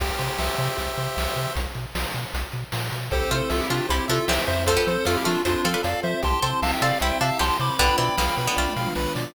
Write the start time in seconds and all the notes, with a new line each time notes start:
0.00 C2 G4, kick, crash
0.19 C3 C5, closed hi-hat
0.38 C2 E5, snare
0.58 C3 C5, closed hi-hat
0.77 C2 G4, kick, closed hi-hat
0.97 C3 C5, closed hi-hat
1.16 C2 E5, snare
1.36 C3 C5, closed hi-hat
1.56 B1, kick, closed hi-hat
1.75 B2, closed hi-hat
1.95 B1, snare
2.14 B2, closed hi-hat
2.34 B1, kick, closed hi-hat
2.52 B2, closed hi-hat
2.72 A#2, snare
2.91 B2, closed hi-hat
3.11 C2 C4 E4 G4 A4 C5, kick, closed hi-hat
3.21 kick
3.31 C3 A3 F4 C5, closed hi-hat
3.50 C2 F4 A4 E5, snare
3.60 E4 G4
3.70 C3 A3 D4 F4 G4, closed hi-hat
3.89 C2 G3 E4 G4 C5, kick, closed hi-hat
4.08 C3 F3 D4 F4 A4 E5, closed hi-hat
4.28 C2 E3 C4 G4 C5 E5, snare
4.47 F2 C5 E5, closed hi-hat
4.67 A3 C4 F4 A4 C5, kick, closed hi-hat
4.77 B3 G4
4.87 F3 C5, closed hi-hat
5.05 F2 A3 F4 A4 F5, snare
5.16 E4 G4
5.24 F3 A3 D4 F4 A4, closed hi-hat
5.45 F2 D4 E4 F4 C5, kick, closed hi-hat
5.64 F3 C4 F4 A4 F5, closed hi-hat
5.74 D4 B4
5.83 F2 A4 D5 F5, closed hi-hat
6.03 F3 C5 E5, closed hi-hat
6.22 C2 C4 E4 G4 A5 C6, kick, closed hi-hat
6.33 kick
6.42 C3 C4 A4 C5, closed hi-hat
6.62 C2 E5 F5 A5, snare
6.73 E5 G5
6.82 C3 C4 G4 A4 D5 F5, closed hi-hat
7.00 C2 G3 E4 C5 E5 G5, kick, closed hi-hat
7.21 C3 F3 D4 E5 F5 A5, closed hi-hat
7.39 C2 B3 G4 A5 C6, snare
7.60 C3 C5 B5 D6, closed hi-hat
7.78 B1 D3 B3 D4 F4 B4 G5 B5, kick, closed hi-hat
7.89 kick
7.98 B2 E3 C4 D5 G5 B5, closed hi-hat
8.18 B1 D3 B3 F5, snare
8.37 B2 B4, closed hi-hat
8.47 D3 B3
8.56 B1 A3 F4 D5, kick, snare
8.68 high tom
8.76 B2 F5, snare
8.86 mid tom
8.95 B1 B4, snare
9.15 B2 D5, snare